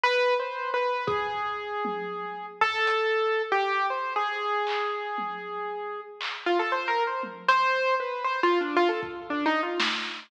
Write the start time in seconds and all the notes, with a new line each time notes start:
0.04 B4
0.40 C5
0.74 B4
1.07 G#4, kick
1.85 high tom
2.61 A4, floor tom
2.87 closed hi-hat
3.52 G4
3.90 C5
4.16 G#4
4.67 clap
5.18 high tom
6.21 clap
6.46 F4
6.59 A4
6.72 C5
6.88 A#4
7.07 C5
7.23 high tom
7.48 C5, closed hi-hat
8.00 B4
8.24 C5
8.43 F4
8.61 D4
8.76 F4
8.89 A4
9.03 kick
9.30 D4
9.46 D#4
9.63 F4
9.80 snare